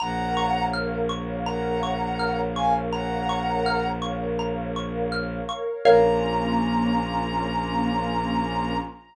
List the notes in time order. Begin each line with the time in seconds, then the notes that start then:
0.00 A#1 A#4 C#5 F5 F#5 A#5
0.37 C#6
0.73 F6
1.09 C#6
1.46 F#5 A#5
1.83 C#6
2.19 F6
2.56 F5 G#5 C#6
2.93 F#5 A#5
3.29 C#6
3.66 F6
4.02 C#6
4.39 A#5
4.76 C#6
5.12 F6
5.49 C#6
5.85 A#1 A#3 C#4 F4 A#4 C#5 F5 A#5